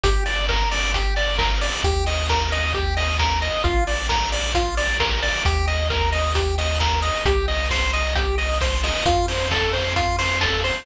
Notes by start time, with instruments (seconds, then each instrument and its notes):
0.04 synth bass 1 G1, lead 1 (square) G4, kick, closed hi-hat
0.26 lead 1 (square) D5, open hi-hat
0.49 lead 1 (square) A#4, kick, snare
0.71 lead 1 (square) D5, snare, open hi-hat
0.94 lead 1 (square) G4, kick, closed hi-hat
1.16 lead 1 (square) D5, open hi-hat
1.38 lead 1 (square) A#4, kick, snare
1.61 lead 1 (square) D5, open hi-hat
1.84 synth bass 1 D#2, lead 1 (square) G4, kick, closed hi-hat
2.06 lead 1 (square) D#5, open hi-hat
2.29 lead 1 (square) A#4, kick, snare
2.52 lead 1 (square) D#5, snare, open hi-hat
2.74 lead 1 (square) G4, kick, closed hi-hat
2.97 lead 1 (square) D#5, open hi-hat
3.19 lead 1 (square) A#4, kick, snare
3.42 lead 1 (square) D#5, open hi-hat
3.64 synth bass 1 A#1, lead 1 (square) F4, kick, closed hi-hat
3.87 lead 1 (square) D5, open hi-hat
4.09 lead 1 (square) A#4, kick, snare
4.32 lead 1 (square) D5, snare, open hi-hat
4.54 lead 1 (square) F4, kick, closed hi-hat
4.77 lead 1 (square) D5, open hi-hat
5.00 lead 1 (square) A#4, kick, snare
5.22 lead 1 (square) D5, open hi-hat
5.45 synth bass 1 D#2, lead 1 (square) G4, kick, closed hi-hat
5.67 lead 1 (square) D#5, open hi-hat
5.90 lead 1 (square) A#4, kick, snare
6.12 lead 1 (square) D#5, snare, open hi-hat
6.35 lead 1 (square) G4, kick, closed hi-hat
6.58 lead 1 (square) D#5, open hi-hat
6.80 lead 1 (square) A#4, kick, snare
7.02 lead 1 (square) D#5, open hi-hat
7.25 synth bass 1 C2, lead 1 (square) G4, kick, closed hi-hat
7.48 lead 1 (square) D#5, open hi-hat
7.70 lead 1 (square) C5, kick, snare
7.93 lead 1 (square) D#5, snare, open hi-hat
8.15 lead 1 (square) G4, kick, closed hi-hat
8.38 lead 1 (square) D#5, open hi-hat
8.61 lead 1 (square) C5, kick, snare
8.83 lead 1 (square) D#5, open hi-hat
9.06 synth bass 1 F2, lead 1 (square) F4, kick, closed hi-hat
9.28 lead 1 (square) C5, open hi-hat
9.51 lead 1 (square) A4, kick, snare
9.73 lead 1 (square) C5, snare, open hi-hat
9.96 lead 1 (square) F4, kick, closed hi-hat
10.19 lead 1 (square) C5, open hi-hat
10.41 lead 1 (square) A4, kick, snare
10.64 lead 1 (square) C5, open hi-hat